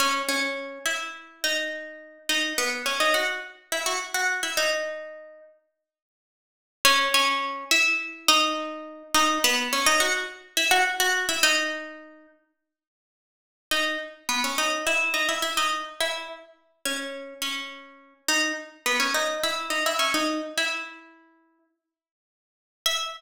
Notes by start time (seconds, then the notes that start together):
0.00 C#4 C#5
0.29 C#4 C#5
0.86 E4 E5
1.44 D#4 D#5
2.29 D#4 D#5
2.58 B3 B4
2.86 C#4 C#5
3.00 D#4 D#5
3.14 F#4 F#5
3.72 E4 E5
3.86 F#4 F#5
4.14 F#4 F#5
4.43 E4 E5
4.57 D#4 D#5
6.85 C#4 C#5
7.14 C#4 C#5
7.71 E4 E5
8.28 D#4 D#5
9.14 D#4 D#5
9.44 B3 B4
9.73 C#4 C#5
9.86 D#4 D#5
10.00 F#4 F#5
10.57 E4 E5
10.71 F#4 F#5
11.00 F#4 F#5
11.29 E4 E5
11.43 D#4 D#5
13.71 D#4 D#5
14.29 B3 B4
14.44 C#4 C#5
14.58 D#4 D#5
14.87 E4 E5
15.14 D#4 D#5
15.29 E4 E5
15.42 E4 E5
15.57 D#4 D#5
16.00 E4 E5
16.85 C#4 C#5
17.42 C#4 C#5
18.28 D#4 D#5
18.86 B3 B4
19.00 C#4 C#5
19.14 D#4 D#5
19.43 E4 E5
19.70 D#4 D#5
19.86 E4 E5
19.99 C#4 C#5
20.14 D#4 D#5
20.58 E4 E5
22.86 E5